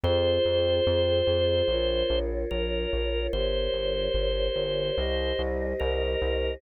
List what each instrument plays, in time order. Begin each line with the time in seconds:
0.04 synth bass 1 F2, choir aahs F4 G#4 C5, drawbar organ C5
0.45 synth bass 1 F2
0.87 synth bass 1 F2
1.27 synth bass 1 F2
1.68 synth bass 1 A#1, choir aahs F4 A#4 C#5
2.10 synth bass 1 A#1
2.51 synth bass 1 A#1, drawbar organ A#4
2.93 synth bass 1 A#1
3.33 synth bass 1 G1, choir aahs G4 A#4 C#5, drawbar organ C5
3.73 synth bass 1 G1
4.14 synth bass 1 G1
4.56 synth bass 1 G1
4.98 synth bass 1 C2, choir aahs G4 C5 D#5
5.39 synth bass 1 C2
5.80 synth bass 1 C2, drawbar organ A#4
6.22 synth bass 1 C2